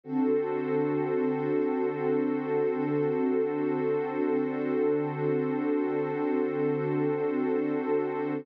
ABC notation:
X:1
M:4/4
L:1/8
Q:1/4=57
K:Glyd
V:1 name="Pad 2 (warm)"
[D,=CFA]8 | [D,=CDA]8 |]
V:2 name="Pad 2 (warm)"
[DFA=c]8- | [DFA=c]8 |]